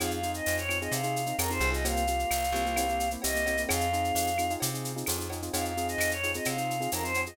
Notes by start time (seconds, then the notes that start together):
0.00 F2 C4 D#4 F4 G#4 F5, cowbell, claves, shaker
0.11 F5, shaker
0.23 C4 D#4 F4 G#4, shaker
0.34 D#5, shaker
0.46 F2, tambourine, shaker
0.58 C#5, shaker
0.69 C4 D#4 F4 G#4, claves, shaker
0.81 C4 D#4 F4 G#4 D#5, shaker
0.92 C3 F5, cowbell, shaker
1.03 C4 D#4 F4 G#4, shaker
1.16 shaker
1.26 C4 D#4 F4 G#4, shaker
1.39 F2 C4 D#4 F4 G#4 A#4, tambourine, cowbell, claves, shaker
1.50 C4 D#4 F4 G#4 C5, shaker
1.60 C2 C4 D#4 F4 G#4, cowbell, shaker
1.72 C4 D#4 F4 G#4 D#5, shaker
1.85 A#3 C4 F4 G4 F5, cowbell, shaker
1.97 shaker
2.07 A#3 C4 F4 G4, shaker
2.19 shaker
2.31 C2, tambourine, claves, shaker
2.44 shaker
2.52 C2 A#3 C4 F4 G4, shaker
2.66 A#3 C4 F4 G4, shaker
2.76 A#3 C4 E4 G4, cowbell, claves, shaker
2.89 A#3 C4 E4 G4, shaker
3.00 shaker
3.11 A#3 C4 E4 G4, shaker
3.22 C2 A#3 C4 E4 G4 D#5, tambourine, cowbell, shaker
3.35 A#3 C4 E4 G4, shaker
3.46 A#3 C4 E4 G4, cowbell, shaker
3.57 A#3 C4 E4 G4, shaker
3.69 F2 C4 D#4 F4 G#4 F5, cowbell, claves, shaker
3.80 shaker
3.93 C4 D#4 F4 G#4, shaker
4.04 shaker
4.15 F2, tambourine, shaker
4.27 shaker
4.38 C4 D#4 F4 G#4, claves, shaker
4.50 C4 D#4 F4 G#4, shaker
4.60 C3, cowbell, shaker
4.74 C4 D#4 F4 G#4, shaker
4.85 shaker
4.96 C4 D#4 F4 G#4, shaker
5.06 F2 C4 D#4 F4 G#4, tambourine, cowbell, claves, shaker
5.18 C4 D#4 F4 G#4, shaker
5.30 C4 D#4 F4 G#4, cowbell, shaker
5.42 C4 D#4 F4 G#4, shaker
5.53 F2 C4 D#4 F4 G#4 F5, cowbell, shaker
5.65 F5, shaker
5.77 C4 D#4 F4 G#4, shaker
5.88 D#5, shaker
5.98 F2, tambourine, claves, shaker
6.11 C#5, shaker
6.23 C4 D#4 F4 G#4, shaker
6.34 C4 D#4 F4 G#4 D#5, shaker
6.45 C3 F5, cowbell, claves, shaker
6.57 C4 D#4 F4 G#4, shaker
6.70 shaker
6.80 C4 D#4 F4 G#4, shaker
6.92 F2 C4 D#4 F4 G#4 A#4, tambourine, cowbell, shaker
7.03 C4 D#4 F4 G#4 C5, shaker
7.14 C4 D#4 F4 G#4, cowbell, shaker
7.26 C4 D#4 F4 G#4 D#5, shaker